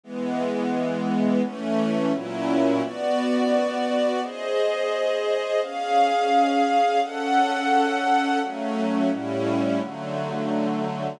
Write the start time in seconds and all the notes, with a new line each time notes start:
0.03 E3 G#3 B3
1.43 E3 A3 C#4
2.13 A#2 F#3 C#4 E4
2.82 B3 F#4 D5
4.22 G#4 C5 D#5
5.62 C#4 G#4 F5
7.01 C#4 A4 F#5
8.41 F#3 A3 C#4
9.11 A2 G3 C#4 E4
9.80 D3 F#3 A3